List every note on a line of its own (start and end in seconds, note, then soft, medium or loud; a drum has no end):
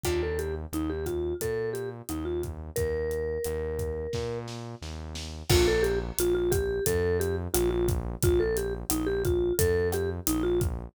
0.04 0.66 D#2 medium
0.04 0.53 A#3 medium
0.04 0.53 D4 medium
0.04 0.53 D#4 medium
0.04 0.21 F4 loud
0.04 0.53 G4 medium
0.04 kick medium
0.04 cross-stick loud
0.04 closed hi-hat loud
0.23 0.39 A4 medium
0.39 0.55 G4 medium
0.39 closed hi-hat medium
0.72 1.34 D#2 medium
0.72 0.90 D#4 medium
0.72 closed hi-hat medium
0.90 1.06 G4 medium
1.06 1.34 F4 medium
1.06 kick medium
1.06 cross-stick medium
1.06 closed hi-hat medium
1.41 2.02 A#2 medium
1.41 1.70 A4 medium
1.41 kick medium
1.41 closed hi-hat loud
1.73 1.89 G4 medium
1.73 closed hi-hat medium
2.09 2.71 D#2 medium
2.09 2.25 D#4 medium
2.09 cross-stick medium
2.09 closed hi-hat medium
2.25 2.41 F4 medium
2.43 kick medium
2.43 closed hi-hat medium
2.76 3.38 D#2 medium
2.76 4.38 A#4 loud
2.76 kick loud
2.76 closed hi-hat loud
3.11 closed hi-hat medium
3.44 4.07 D#2 medium
3.44 cross-stick medium
3.44 closed hi-hat loud
3.79 kick medium
3.79 closed hi-hat medium
4.13 4.75 A#2 medium
4.13 kick medium
4.13 snare medium
4.48 snare medium
4.82 5.43 D#2 medium
4.82 snare medium
5.15 snare loud
5.50 6.12 A#1 loud
5.50 5.97 A#3 medium
5.50 5.97 D4 loud
5.50 5.97 F4 loud
5.50 5.67 F4 loud
5.50 5.97 A4 loud
5.50 kick loud
5.50 cross-stick loud
5.50 crash loud
5.68 5.84 A4 loud
5.83 5.99 G4 loud
5.83 closed hi-hat medium
6.18 6.80 A#1 medium
6.18 6.34 F4 loud
6.18 closed hi-hat loud
6.35 6.51 F4 loud
6.51 6.84 G4 loud
6.51 kick loud
6.51 cross-stick loud
6.51 closed hi-hat loud
6.86 7.48 F2 loud
6.86 7.18 A4 loud
6.86 kick medium
6.86 closed hi-hat loud
7.20 7.36 G4 loud
7.20 closed hi-hat medium
7.54 8.16 A#1 loud
7.54 7.70 F4 loud
7.54 cross-stick loud
7.54 closed hi-hat loud
7.70 7.87 F4 loud
7.88 kick loud
7.88 closed hi-hat loud
8.22 8.84 A#1 loud
8.22 8.40 F4 loud
8.22 kick loud
8.22 closed hi-hat loud
8.40 8.56 A4 loud
8.57 8.74 G4 loud
8.57 closed hi-hat loud
8.90 9.52 A#1 loud
8.90 9.07 D#4 loud
8.90 cross-stick loud
8.90 closed hi-hat loud
9.07 9.23 G4 loud
9.25 9.53 F4 loud
9.25 kick loud
9.25 closed hi-hat medium
9.59 10.20 F2 loud
9.59 9.88 A4 loud
9.59 kick loud
9.59 closed hi-hat loud
9.92 10.10 G4 loud
9.92 cross-stick loud
9.92 closed hi-hat medium
10.27 10.89 A#1 loud
10.27 10.43 D#4 loud
10.27 closed hi-hat loud
10.43 10.59 F4 loud
10.61 kick loud
10.61 closed hi-hat medium